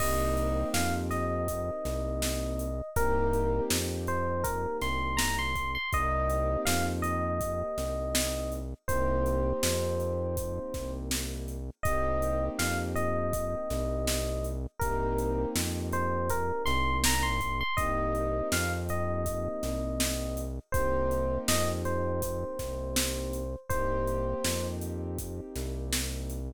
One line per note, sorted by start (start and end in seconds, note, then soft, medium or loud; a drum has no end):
0.00 0.65 C2 loud
0.00 2.68 A#3 medium
0.00 2.68 C4 medium
0.00 2.68 D#4 loud
0.00 2.68 G4 medium
0.00 0.69 D#5 loud
0.00 kick medium
0.00 crash loud
0.37 closed hi-hat medium
0.74 1.71 F2 medium
0.74 0.94 F5 medium
0.74 snare loud
1.10 2.89 D#5 medium
1.10 snare soft
1.10 closed hi-hat medium
1.48 kick medium
1.48 closed hi-hat loud
1.85 2.82 C2 medium
1.85 snare medium
1.85 closed hi-hat medium
2.22 snare loud
2.59 closed hi-hat medium
2.96 3.61 C2 loud
2.96 5.64 A#3 loud
2.96 5.64 C4 medium
2.96 5.64 D#4 medium
2.96 5.64 G4 loud
2.96 3.63 A#4 loud
2.96 kick loud
2.96 closed hi-hat loud
3.33 closed hi-hat medium
3.70 4.67 F2 medium
3.70 snare loud
4.07 4.44 C5 loud
4.07 closed hi-hat medium
4.44 4.77 A#4 medium
4.44 kick loud
4.44 closed hi-hat loud
4.81 5.78 C2 medium
4.81 5.17 C6 medium
4.81 snare medium
4.81 closed hi-hat medium
5.17 5.37 A#5 medium
5.17 snare loud
5.39 5.72 C6 medium
5.56 kick medium
5.56 closed hi-hat medium
5.75 5.90 C6 loud
5.93 6.57 C2 loud
5.93 8.60 A#3 medium
5.93 8.60 C4 medium
5.93 8.60 D#4 medium
5.93 8.60 G4 medium
5.93 6.61 D#5 loud
5.93 kick loud
5.93 closed hi-hat medium
6.30 closed hi-hat medium
6.65 7.63 F2 medium
6.65 6.85 F5 medium
6.65 snare loud
7.02 8.53 D#5 loud
7.02 closed hi-hat medium
7.41 kick medium
7.41 closed hi-hat loud
7.78 8.74 C2 medium
7.78 snare medium
7.78 closed hi-hat medium
8.15 snare loud
8.52 closed hi-hat medium
8.88 9.53 C2 loud
8.88 11.57 A#3 medium
8.88 11.57 C4 medium
8.88 11.57 D#4 medium
8.88 11.57 G4 medium
8.88 10.92 C5 loud
8.88 kick loud
8.88 closed hi-hat loud
9.26 closed hi-hat medium
9.63 10.59 F2 medium
9.63 snare loud
10.00 closed hi-hat medium
10.37 kick loud
10.37 closed hi-hat loud
10.74 11.70 C2 medium
10.74 kick medium
10.74 snare medium
10.74 closed hi-hat medium
11.11 snare loud
11.48 closed hi-hat medium
11.83 12.50 C2 medium
11.83 14.53 A#3 medium
11.83 14.53 C4 loud
11.83 14.53 D#4 medium
11.83 14.53 G4 medium
11.83 12.45 D#5 loud
11.83 kick loud
11.83 closed hi-hat loud
12.22 closed hi-hat medium
12.59 13.56 F2 medium
12.59 12.78 F5 medium
12.59 snare loud
12.96 14.46 D#5 medium
12.96 closed hi-hat medium
13.33 kick loud
13.33 closed hi-hat loud
13.70 14.67 C2 medium
13.70 snare medium
13.70 closed hi-hat medium
14.07 snare loud
14.44 closed hi-hat medium
14.79 15.46 C2 loud
14.79 17.49 A#3 medium
14.79 17.49 C4 medium
14.79 17.49 D#4 medium
14.79 17.49 G4 medium
14.79 15.48 A#4 loud
14.79 kick loud
14.79 closed hi-hat loud
15.19 closed hi-hat medium
15.55 16.52 F2 medium
15.55 snare loud
15.93 16.29 C5 loud
15.93 closed hi-hat medium
16.30 16.62 A#4 loud
16.30 kick medium
16.30 closed hi-hat loud
16.66 17.63 C2 loud
16.66 16.97 C6 loud
16.66 snare medium
16.66 closed hi-hat medium
17.04 17.25 A#5 medium
17.04 snare loud
17.23 17.58 C6 medium
17.41 kick medium
17.41 closed hi-hat medium
17.61 17.76 C6 loud
17.77 18.42 C2 medium
17.77 20.45 A#3 medium
17.77 20.45 C4 medium
17.77 20.45 D#4 medium
17.77 20.45 G4 medium
17.77 18.48 D#5 loud
17.77 kick loud
17.77 closed hi-hat loud
18.15 closed hi-hat medium
18.52 19.48 F2 medium
18.52 18.72 F5 loud
18.52 snare loud
18.89 20.41 D#5 medium
18.89 closed hi-hat medium
19.26 kick medium
19.26 closed hi-hat loud
19.63 20.59 C2 medium
19.63 snare medium
19.63 closed hi-hat medium
20.00 snare loud
20.37 closed hi-hat medium
20.72 21.38 C2 medium
20.72 23.41 A#3 medium
20.72 23.41 C4 medium
20.72 23.41 D#4 medium
20.72 23.41 G4 medium
20.72 21.38 C5 loud
20.72 kick loud
20.72 closed hi-hat loud
21.11 closed hi-hat medium
21.48 22.45 F2 medium
21.48 21.68 D#5 loud
21.48 snare loud
21.85 23.54 C5 medium
21.85 closed hi-hat medium
22.22 kick medium
22.22 closed hi-hat loud
22.59 23.56 C2 medium
22.59 kick medium
22.59 snare medium
22.59 closed hi-hat medium
22.96 snare loud
23.33 closed hi-hat medium
23.69 24.35 C2 medium
23.69 26.38 A#3 medium
23.69 26.38 C4 medium
23.69 26.38 D#4 medium
23.69 26.38 G4 loud
23.69 24.67 C5 loud
23.69 kick loud
23.69 closed hi-hat medium
24.07 closed hi-hat medium
24.44 25.41 F2 medium
24.44 snare loud
24.81 closed hi-hat medium
25.19 kick medium
25.19 closed hi-hat loud
25.56 26.52 C2 medium
25.56 snare medium
25.56 closed hi-hat medium
25.93 snare loud
26.30 closed hi-hat medium